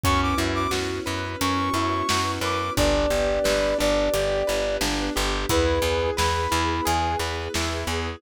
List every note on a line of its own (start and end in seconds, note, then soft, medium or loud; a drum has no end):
0.03 0.34 F#2 medium
0.03 2.75 B3 medium
0.03 0.35 C#4 loud
0.03 2.75 C#4 medium
0.03 2.75 E4 loud
0.03 2.75 F#4 medium
0.03 0.21 C#6 loud
0.03 kick loud
0.03 closed hi-hat loud
0.22 0.39 D6 medium
0.38 0.67 F#2 medium
0.38 0.68 E4 medium
0.55 0.71 D6 medium
0.71 1.00 F#2 medium
0.71 1.02 F#4 medium
0.71 snare loud
1.06 1.36 F#2 medium
1.06 1.37 B4 medium
1.41 1.70 F#2 medium
1.41 1.72 C#4 medium
1.41 2.31 C#6 medium
1.41 closed hi-hat loud
1.74 2.03 F#2 medium
1.74 2.06 E4 medium
2.09 2.39 F#2 medium
2.09 2.40 F#4 medium
2.09 snare loud
2.41 2.70 F#2 medium
2.41 2.73 B4 medium
2.41 2.73 D6 medium
2.76 3.06 G1 loud
2.76 5.46 B3 medium
2.76 5.46 D4 medium
2.76 3.08 D4 loud
2.76 5.46 G4 loud
2.76 3.78 D5 loud
2.76 kick loud
2.76 closed hi-hat medium
3.10 3.39 G1 medium
3.10 3.41 G4 medium
3.44 3.74 G1 medium
3.44 3.75 B4 medium
3.44 snare loud
3.78 4.09 G1 medium
3.78 4.09 D4 medium
3.78 4.76 D5 loud
4.13 4.43 G1 medium
4.13 4.44 G4 loud
4.13 closed hi-hat loud
4.47 4.78 G1 medium
4.47 4.78 B4 medium
4.81 5.10 G1 loud
4.81 5.12 D4 loud
4.81 snare loud
5.16 5.46 G1 loud
5.16 5.46 G4 medium
5.49 5.79 E2 loud
5.49 8.20 B3 medium
5.49 5.80 E4 loud
5.49 8.20 E4 medium
5.49 8.20 G#4 loud
5.49 6.10 B4 medium
5.49 kick loud
5.49 closed hi-hat loud
5.82 6.11 E2 medium
5.82 6.14 G#4 medium
6.17 6.47 E2 medium
6.17 6.48 B4 medium
6.17 6.85 B5 medium
6.17 snare loud
6.51 6.81 E2 loud
6.51 6.82 E4 medium
6.85 7.16 E2 medium
6.85 7.16 G#4 medium
6.85 7.18 G#5 medium
6.85 closed hi-hat loud
7.19 7.48 E2 medium
7.19 7.51 B4 medium
7.54 7.84 E2 medium
7.54 7.86 E4 medium
7.54 snare loud
7.87 8.16 E2 medium
7.87 8.18 G#4 medium